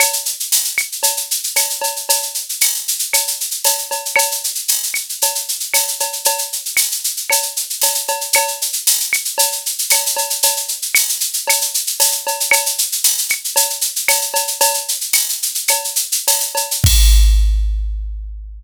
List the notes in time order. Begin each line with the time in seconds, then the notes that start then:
0.00 cowbell, claves, shaker
0.13 shaker
0.25 shaker
0.40 shaker
0.52 tambourine, shaker
0.64 shaker
0.78 claves, shaker
0.92 shaker
1.03 cowbell, shaker
1.17 shaker
1.31 shaker
1.44 shaker
1.56 tambourine, cowbell, claves, shaker
1.70 shaker
1.82 cowbell, shaker
1.96 shaker
2.09 cowbell, shaker
2.22 shaker
2.34 shaker
2.49 shaker
2.61 tambourine, claves, shaker
2.74 shaker
2.88 shaker
2.99 shaker
3.13 cowbell, claves, shaker
3.27 shaker
3.41 shaker
3.51 shaker
3.64 tambourine, cowbell, shaker
3.78 shaker
3.91 cowbell, shaker
4.05 shaker
4.16 cowbell, claves, shaker
4.31 shaker
4.44 shaker
4.55 shaker
4.68 tambourine, shaker
4.83 shaker
4.94 claves, shaker
5.09 shaker
5.22 cowbell, shaker
5.35 shaker
5.48 shaker
5.60 shaker
5.74 tambourine, cowbell, claves, shaker
5.88 shaker
6.00 cowbell, shaker
6.13 shaker
6.25 cowbell, shaker
6.38 shaker
6.52 shaker
6.66 shaker
6.77 tambourine, claves, shaker
6.92 shaker
7.04 shaker
7.17 shaker
7.30 cowbell, claves, shaker
7.42 shaker
7.56 shaker
7.70 shaker
7.82 tambourine, cowbell, shaker
7.95 shaker
8.08 cowbell, shaker
8.21 shaker
8.33 cowbell, claves, shaker
8.48 shaker
8.62 shaker
8.73 shaker
8.87 tambourine, shaker
9.00 shaker
9.13 claves, shaker
9.25 shaker
9.38 cowbell, shaker
9.52 shaker
9.66 shaker
9.78 shaker
9.90 tambourine, cowbell, claves, shaker
10.06 shaker
10.17 cowbell, shaker
10.30 shaker
10.43 cowbell, shaker
10.57 shaker
10.68 shaker
10.82 shaker
10.95 tambourine, claves, shaker
11.09 shaker
11.20 shaker
11.33 shaker
11.47 cowbell, claves, shaker
11.61 shaker
11.74 shaker
11.87 shaker
12.00 tambourine, cowbell, shaker
12.12 shaker
12.27 cowbell, shaker
12.40 shaker
12.51 cowbell, claves, shaker
12.66 shaker
12.78 shaker
12.92 shaker
13.04 tambourine, shaker
13.18 shaker
13.29 claves, shaker
13.44 shaker
13.56 cowbell, shaker
13.70 shaker
13.81 shaker
13.96 shaker
14.08 tambourine, cowbell, claves, shaker
14.22 shaker
14.34 cowbell, shaker
14.47 shaker
14.61 cowbell, shaker
14.74 shaker
14.88 shaker
15.01 shaker
15.13 tambourine, claves, shaker
15.29 shaker
15.42 shaker
15.55 shaker
15.68 cowbell, claves, shaker
15.84 shaker
15.96 shaker
16.12 shaker
16.28 tambourine, cowbell, shaker
16.40 shaker
16.55 cowbell, shaker
16.71 shaker
16.84 kick, crash